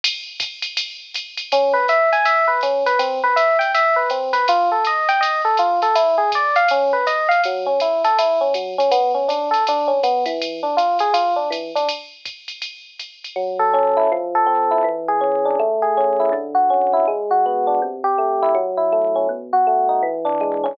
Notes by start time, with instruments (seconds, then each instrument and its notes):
0.04 ride
0.40 kick, hi-hat pedal, ride
0.62 ride
0.77 ride
1.14 hi-hat pedal, ride
1.37 ride
1.52 electric piano 1 C#4, ride
1.74 electric piano 1 B4
1.88 electric piano 1 E5, hi-hat pedal, ride
2.12 electric piano 1 G#5, ride
2.25 electric piano 1 E5, ride
2.48 electric piano 1 B4
2.61 electric piano 1 C#4, hi-hat pedal, ride
2.86 electric piano 1 B4, ride
2.99 electric piano 1 C4, ride
3.24 electric piano 1 B4
3.36 electric piano 1 E5, hi-hat pedal, ride
3.59 electric piano 1 G5, ride
3.74 electric piano 1 E5, ride
3.96 electric piano 1 B4
4.10 electric piano 1 C4, hi-hat pedal, ride
4.33 electric piano 1 B4, ride
4.48 electric piano 1 F4, ride
4.72 electric piano 1 A4
4.85 electric piano 1 D#5, hi-hat pedal, ride
5.09 electric piano 1 G5, ride
5.21 electric piano 1 D#5, ride
5.45 electric piano 1 A4
5.57 electric piano 1 F4, hi-hat pedal, ride
5.82 electric piano 1 A4, ride
5.95 electric piano 1 E4, ride
6.18 electric piano 1 G#4
6.32 electric piano 1 D5, kick, hi-hat pedal, ride
6.56 electric piano 1 F5, ride
6.68 electric piano 1 C#4, ride
6.93 electric piano 1 B4
7.07 electric piano 1 D#5, kick, hi-hat pedal, ride
7.29 electric piano 1 F5, ride
7.44 electric piano 1 F#3, ride
7.66 electric piano 1 C#4
7.80 electric piano 1 E4, hi-hat pedal, ride
8.04 electric piano 1 A4, ride
8.19 electric piano 1 E4, ride
8.41 electric piano 1 C#4
8.54 electric piano 1 F#3, hi-hat pedal, ride
8.78 electric piano 1 C#4, ride
8.91 electric piano 1 B3, kick, ride
9.14 electric piano 1 C#4
9.28 electric piano 1 D4, hi-hat pedal, ride
9.51 electric piano 1 A4, ride
9.67 electric piano 1 D4, ride
9.87 electric piano 1 C#4
10.03 electric piano 1 B3, hi-hat pedal, ride
10.26 electric piano 1 E3, ride
10.42 ride
10.63 electric piano 1 D4
10.77 electric piano 1 F4, hi-hat pedal, ride
10.99 electric piano 1 G#4, ride
11.14 electric piano 1 F4, ride
11.36 electric piano 1 D4
11.50 electric piano 1 E3, hi-hat pedal, ride
11.75 electric piano 1 D4, ride
11.89 ride
12.25 kick, hi-hat pedal, ride
12.48 ride
12.62 ride
12.99 hi-hat pedal, ride
13.24 ride
13.36 electric piano 1 F#3
13.59 electric piano 1 A4
13.73 electric piano 1 C#4
13.97 electric piano 1 E4
14.12 electric piano 1 F3
14.35 electric piano 1 A4
14.46 electric piano 1 C4
14.71 electric piano 1 E4
14.84 electric piano 1 E3
15.08 electric piano 1 G#4
15.21 electric piano 1 C#4
15.45 electric piano 1 D4
15.59 electric piano 1 A3
15.82 electric piano 1 G#4
15.97 electric piano 1 C#4
16.20 electric piano 1 E4
16.32 electric piano 1 D3
16.55 electric piano 1 F#4
16.70 electric piano 1 C#4
16.93 electric piano 1 E4
17.08 electric piano 1 G#3
17.31 electric piano 1 F#4
17.46 electric piano 1 B3
17.67 electric piano 1 D4
17.82 electric piano 1 C3
18.04 electric piano 1 G4
18.18 electric piano 1 A3
18.42 electric piano 1 E4
18.55 electric piano 1 F#3
18.77 electric piano 1 E4
18.92 electric piano 1 A3
19.16 electric piano 1 C#4
19.29 electric piano 1 B2
19.53 electric piano 1 F#4
19.67 electric piano 1 A3
19.89 electric piano 1 D#4
20.03 electric piano 1 E3
20.25 electric piano 1 D4
20.41 electric piano 1 G#3
20.64 electric piano 1 C#4